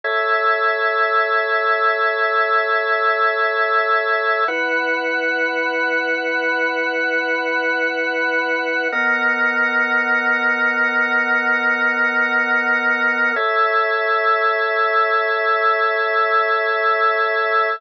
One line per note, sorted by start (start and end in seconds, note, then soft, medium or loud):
0.04 4.44 A4 medium
0.04 4.44 C#5 medium
0.04 4.44 E5 medium
4.48 8.88 E4 medium
4.48 8.88 B4 loud
4.48 8.88 F#5 medium
8.92 13.32 B3 medium
8.92 13.32 A#4 medium
8.92 13.32 D#5 medium
8.92 13.32 F#5 medium
13.36 17.76 A4 medium
13.36 17.76 C#5 medium
13.36 17.76 E5 medium